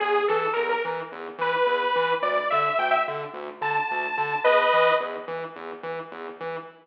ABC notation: X:1
M:4/4
L:1/16
Q:1/4=108
K:Emix
V:1 name="Lead 2 (sawtooth)"
G2 A2 ^A A z4 B6 | d2 e2 =g e z4 a6 | [B^d]4 z12 |]
V:2 name="Synth Bass 1" clef=bass
E,,2 E,2 E,,2 E,2 E,,2 E,2 E,,2 E,2 | D,,2 D,2 D,,2 D,2 D,,2 D,2 D,,2 D,2 | E,,2 E,2 E,,2 E,2 E,,2 E,2 E,,2 E,2 |]